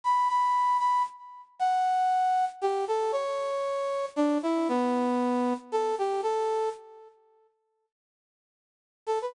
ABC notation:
X:1
M:3/4
L:1/16
Q:1/4=116
K:Bm
V:1 name="Brass Section"
b2 b4 b2 z4 | [K:D] f8 G2 A2 | c8 D2 E2 | B,8 A2 G2 |
A4 z8 | [K:Bm] z10 A B |]